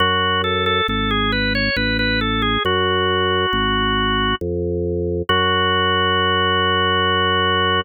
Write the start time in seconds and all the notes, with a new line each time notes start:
0.00 F#2 F#4
0.44 A4
0.66 A4
0.88 G#1 A4
1.11 G#4
1.32 B4
1.55 C#5
1.76 A1 B4
1.99 B4
2.21 A4
2.42 G#4
2.65 F#2 F#4
3.53 G#1
4.41 F2
5.29 F#2 F#4